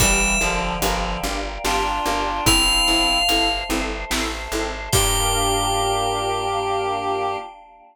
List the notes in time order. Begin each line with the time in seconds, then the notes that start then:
0.00 G1 E3 G3 D4 F4 G4 A#4 D5 E5 F5 G5, kick, closed hi-hat
0.41 G1 D3 F3 D4 F4 G4 A#4
0.82 G1 D3 F3 D4 F4 G4 A#4, closed hi-hat
1.23 G1 D4 F4 G4 A#4
1.64 G1 D4 F4 G4 A#4, snare
2.06 G1 D4 F4 G4 A#4
2.46 G1 C4 E4 A4 C5 E5 F5, kick, closed hi-hat
2.88 G1 C4 E4 A4
3.29 G1 C4 E4 A4, closed hi-hat
3.70 G1 C4 E4 A4
4.10 A1 C4 E4 A4, snare
4.52 G#1 C4 E4 A4
4.92 G2 A#3 D4 F4 G4 A#4 G5, kick, crash